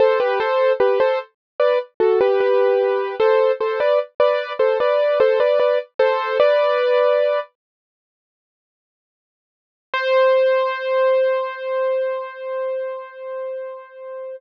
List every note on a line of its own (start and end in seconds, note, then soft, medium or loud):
0.00 0.19 A4 medium
0.00 0.19 C5 medium
0.20 0.39 G4 medium
0.20 0.39 B4 medium
0.40 0.73 A4 medium
0.40 0.73 C5 medium
0.80 0.99 G4 medium
0.80 0.99 B4 medium
1.00 1.19 A4 medium
1.00 1.19 C5 medium
1.60 1.79 B4 medium
1.60 1.79 D5 medium
2.00 2.19 F#4 medium
2.00 2.19 A4 medium
2.21 2.40 G4 medium
2.21 2.40 B4 medium
2.40 3.15 G4 medium
2.40 3.15 B4 medium
3.20 3.52 A4 medium
3.20 3.52 C5 medium
3.61 3.80 A4 medium
3.61 3.80 C5 medium
3.80 3.99 B4 medium
3.80 3.99 D5 medium
4.20 4.53 B4 medium
4.20 4.53 D5 medium
4.59 4.78 A4 medium
4.59 4.78 C5 medium
4.80 5.19 B4 medium
4.80 5.19 D5 medium
5.20 5.39 A4 medium
5.20 5.39 C5 medium
5.40 5.59 B4 medium
5.40 5.59 D5 medium
5.60 5.79 B4 medium
5.60 5.79 D5 medium
5.99 6.38 A4 medium
5.99 6.38 C5 medium
6.40 7.40 B4 medium
6.40 7.40 D5 medium
9.94 14.36 C5 loud